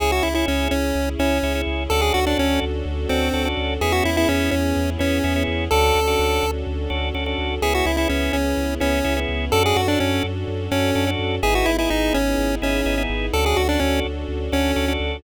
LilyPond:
<<
  \new Staff \with { instrumentName = "Lead 1 (square)" } { \time 4/4 \key cis \phrygian \tempo 4 = 126 gis'16 fis'16 e'16 e'16 cis'8 cis'4 cis'4 r8 | a'16 gis'16 fis'16 d'16 cis'8 r4 bis4 r8 | gis'16 fis'16 e'16 e'16 cis'8 cis'4 cis'4 r8 | a'2 r2 |
gis'16 fis'16 e'16 e'16 cis'8 cis'4 cis'4 r8 | a'16 gis'16 fis'16 d'16 cis'8 r4 cis'4 r8 | gis'16 fis'16 e'16 e'16 dis'8 cis'4 cis'4 r8 | a'16 gis'16 fis'16 d'16 cis'8 r4 cis'4 r8 | }
  \new Staff \with { instrumentName = "Drawbar Organ" } { \time 4/4 \key cis \phrygian <cis' e' gis'>8. <cis' e' gis'>4.~ <cis' e' gis'>16 <cis' e' gis'>8 <cis' e' gis'>16 <cis' e' gis'>8. | <cis' d' fis' a'>8. <cis' d' fis' a'>4.~ <cis' d' fis' a'>16 <cis' d' fis' a'>8 <cis' d' fis' a'>16 <cis' d' fis' a'>8. | <b cis' e' gis'>8. <b cis' e' gis'>4.~ <b cis' e' gis'>16 <b cis' e' gis'>8 <b cis' e' gis'>16 <b cis' e' gis'>8. | <cis' d' fis' a'>8. <cis' d' fis' a'>4.~ <cis' d' fis' a'>16 <cis' d' fis' a'>8 <cis' d' fis' a'>16 <cis' d' fis' a'>8. |
<b cis' e' gis'>8. <b cis' e' gis'>4.~ <b cis' e' gis'>16 <b cis' e' gis'>8 <b cis' e' gis'>16 <b cis' e' gis'>8. | <cis' d' fis' a'>8. <cis' d' fis' a'>4.~ <cis' d' fis' a'>16 <cis' d' fis' a'>8 <cis' d' fis' a'>16 <cis' d' fis' a'>8. | <b dis' e' gis'>8. <b dis' e' gis'>4.~ <b dis' e' gis'>16 <b dis' e' gis'>8 <b dis' e' gis'>16 <b dis' e' gis'>8. | <cis' d' fis' a'>8. <cis' d' fis' a'>4.~ <cis' d' fis' a'>16 <cis' d' fis' a'>8 <cis' d' fis' a'>16 <cis' d' fis' a'>8. | }
  \new Staff \with { instrumentName = "Synth Bass 2" } { \clef bass \time 4/4 \key cis \phrygian cis,8 cis,8 cis,8 cis,8 cis,8 cis,8 cis,8 cis,8 | d,8 d,8 d,8 d,8 d,8 d,8 d,8 d,8 | e,8 e,8 e,8 e,8 e,8 e,8 e,8 e,8 | d,8 d,8 d,8 d,8 d,8 d,8 d,8 d,8 |
cis,8 cis,8 cis,8 cis,8 cis,8 cis,8 cis,8 cis,8 | fis,8 fis,8 fis,8 fis,8 fis,8 fis,8 fis,8 fis,8 | gis,,8 gis,,8 gis,,8 gis,,8 gis,,8 gis,,8 gis,,8 gis,,8 | d,8 d,8 d,8 d,8 d,8 d,8 d,8 d,8 | }
  \new Staff \with { instrumentName = "String Ensemble 1" } { \time 4/4 \key cis \phrygian <cis' e' gis'>1 | <cis' d' fis' a'>1 | <b cis' e' gis'>1 | <cis' d' fis' a'>1 |
<b cis' e' gis'>1 | <cis' d' fis' a'>1 | <b dis' e' gis'>1 | <cis' d' fis' a'>1 | }
>>